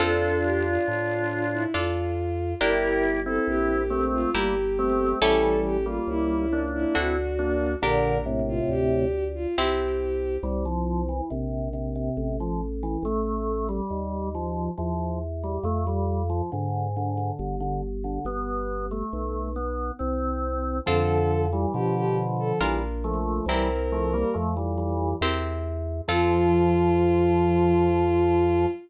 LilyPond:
<<
  \new Staff \with { instrumentName = "Violin" } { \time 3/4 \key f \major \tempo 4 = 69 a'8 g'16 f'16 f'8. e'16 f'4 | bes'8 r16 a'16 g'8. f'16 g'4 | a'8 g'16 f'16 e'8. e'16 fis'4 | bes'8 r16 f'16 g'8. f'16 g'4 |
\key c \major r2. | r2. | r2. | r2. |
\key f \major a'8. r16 g'16 g'16 r16 a'16 r4 | bes'4 r2 | f'2. | }
  \new Staff \with { instrumentName = "Drawbar Organ" } { \time 3/4 \key f \major <d' f'>2 r4 | <e' g'>8. <c' e'>8. <a c'>8 <g bes>16 r16 <a c'>8 | <e g>8. <g bes>8. <bes d'>8 <c' e'>16 r16 <bes d'>8 | <bes, d>8 <a, c>4 r4. |
\key c \major g16 f8 e16 c8 c16 c8 f16 r16 e16 | a8. g8. f8 f8 r16 g16 | a16 g8 f16 d8 d16 d8 d16 r16 d16 | b8. a8. b8 c'4 |
\key f \major <d f>8. <e g>16 <d f>4 <e g>16 r16 <f a>8 | <e g>16 r16 <f a>16 <g bes>16 <f a>16 <e g>16 <e g>8 r4 | f2. | }
  \new Staff \with { instrumentName = "Harpsichord" } { \time 3/4 \key f \major <c' f' a'>2 <d' f' a'>4 | <d' g' bes'>2 <e' g' bes'>4 | <cis' e' g' a'>2 <d' fis' a'>4 | <d' g' bes'>2 <c' e' g'>4 |
\key c \major r2. | r2. | r2. | r2. |
\key f \major <c' f' a'>2 <d' f' bes'>4 | <c' e' g' bes'>2 <c' e' g' bes'>4 | <c' f' a'>2. | }
  \new Staff \with { instrumentName = "Drawbar Organ" } { \clef bass \time 3/4 \key f \major f,4 a,4 f,4 | g,,4 bes,,4 g,,4 | a,,4 cis,4 d,4 | bes,,4 d,4 c,4 |
\key c \major c,4 ais,,4 a,,4 | a,,4 dis,4 e,4 | f,4 gis,4 g,,4 | g,,4 b,,4 c,4 |
\key f \major f,4 b,4 bes,,4 | c,4 f,4 e,4 | f,2. | }
>>